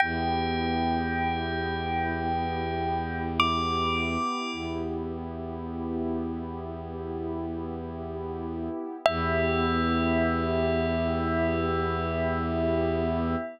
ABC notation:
X:1
M:4/4
L:1/8
Q:1/4=53
K:Edor
V:1 name="Tubular Bells"
g6 d'2 | z8 | e8 |]
V:2 name="Pad 2 (warm)"
[B,EG]8- | [B,EG]8 | [B,EG]8 |]
V:3 name="Violin" clef=bass
E,,8 | E,,8 | E,,8 |]